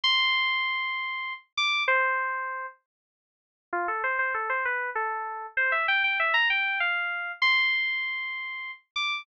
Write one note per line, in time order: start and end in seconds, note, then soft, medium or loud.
0.04 1.33 C6 loud
1.57 1.83 D6 loud
1.88 2.66 C5 loud
3.73 3.87 F4 loud
3.88 4.03 A4 medium
4.04 4.18 C5 medium
4.19 4.33 C5 medium
4.34 4.49 A4 medium
4.49 4.64 C5 medium
4.65 4.90 B4 medium
4.95 5.46 A4 medium
5.57 5.72 C5 loud
5.72 5.87 E5 medium
5.88 6.03 G5 loud
6.04 6.18 G5 medium
6.19 6.34 E5 medium
6.34 6.48 A#5 medium
6.50 6.79 G5 medium
6.80 7.32 F5 medium
7.42 8.71 C6 loud
8.96 9.22 D6 medium